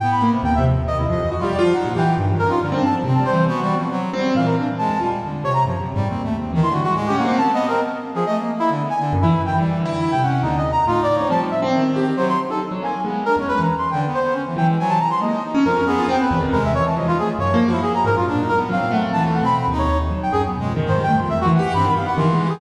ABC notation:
X:1
M:2/4
L:1/16
Q:1/4=138
K:none
V:1 name="Brass Section"
g b2 z g e z2 | ^d E d2 z F =d z | ^f2 g2 z2 ^A =F | z2 a z2 a c2 |
^F3 z5 | f ^A z2 =a3 z | z2 ^c ^a z4 | z5 c' ^F F |
z G ^f2 (3a2 ^d2 ^A2 | z3 ^G ^d z2 E | z2 ^g z2 E2 =g | z4 E g ^f2 |
(3^D2 ^d2 ^a2 (3F2 =d2 ^c2 | a z e z5 | c c' z A z2 ^g2 | z2 ^A ^c (3B2 ^a2 =c'2 |
g z c2 z2 g z | ^g a ^a c' ^d2 z2 | ^A2 ^G2 =g B2 z | ^A e ^c =a ^d F ^G z |
^c2 z E ^G ^a ^A F | z2 ^A z f2 ^f z | a z ^f b b z ^c2 | z2 g ^G z4 |
(3c2 g2 c'2 e ^F ^f2 | b2 f ^f c'3 ^G |]
V:2 name="Brass Section"
B,4 ^D2 F,2 | ^D,2 F,3 G,2 F, | ^D2 E,2 (3^D,2 D,2 D2 | (3D,2 D2 F,2 C4 |
(3B,2 G,2 F,2 ^F,2 G,2 | E,2 D z ^G,2 =G,2 | D,2 z2 (3F,2 ^F,2 G,2 | (3C2 A,2 C2 (3^D,2 =D,2 ^G,2 |
^G,2 ^A,2 (3B,2 B,2 C2 | z3 F, (3A,2 ^A,2 A,2 | (3D,2 B,2 D,2 z E,2 ^D, | G,2 D,4 ^C2 |
D,2 z2 ^D4 | G,2 z2 ^D,4 | ^F,2 z6 | B,2 D ^C3 z2 |
(3D,2 B,2 B,2 ^C E, ^F, ^G, | ^F,2 z2 ^G,2 ^D2 | ^C2 B,2 z4 | ^G,2 E,4 A,2 |
(3^F,2 =F,2 F,2 z4 | (3D2 ^D2 B,2 C4 | (3E,4 C4 ^D4 | z4 (3B,2 ^G,2 ^D,2 |
^D,2 D,6 | C ^D, B, z E,4 |]
V:3 name="Acoustic Grand Piano"
A,,2 ^A, C, (3^D,,2 C,2 D,,2 | z2 F,, E, (3^F2 G2 =F2 | ^F, ^A,, G z (3G,,2 =F,,2 ^C2 | G, C G,, z (3C,2 G,2 E,2 |
C6 C2 | ^A,,2 z3 E,, F z | z2 C,2 (3^F,,2 C,2 ^G,,2 | ^D,,4 E, E G, z |
(3A,,2 ^C2 =C2 ^A, z3 | z8 | z4 ^F,, E, z2 | (3E,4 E4 C,4 |
^D,, z3 A,,2 z C | F, F, z C2 z G z | C,2 z ^D z ^F, ^A, z | ^G,2 z E,, z E, z2 |
z6 E,2 | z C, z ^F ^A, ^D z ^C | F,, ^F2 =F C z E,, ^D, | C,2 z2 F, ^D z2 |
(3^F,,2 ^A,2 ^F2 z2 ^G,, F,, | ^A,,2 z2 ^F, A,, =A,2 | (3^D,,2 A,2 B,,2 z D,,2 z | z ^F,2 ^F,, z B,, =F,, ^D, |
^G,, =G, A, F,, (3E,,2 E,2 G2 | G,, ^D, z2 (3D,2 ^G,2 =G2 |]